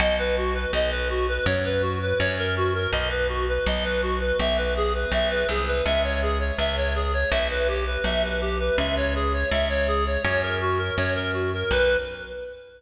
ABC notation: X:1
M:4/4
L:1/16
Q:1/4=82
K:B
V:1 name="Clarinet"
d B F B d B F B c B F B c A F A | d B F B d B F B e B G B e B G B | e c G c e c G c e B =G B e B G B | e c G c e c G c c A F A c A F A |
B4 z12 |]
V:2 name="Electric Bass (finger)" clef=bass
B,,,4 B,,,4 F,,4 F,,4 | B,,,4 B,,,4 B,,,4 B,,,2 =C,,2 | C,,4 C,,4 B,,,4 B,,,4 | C,,4 C,,4 F,,4 F,,4 |
B,,,4 z12 |]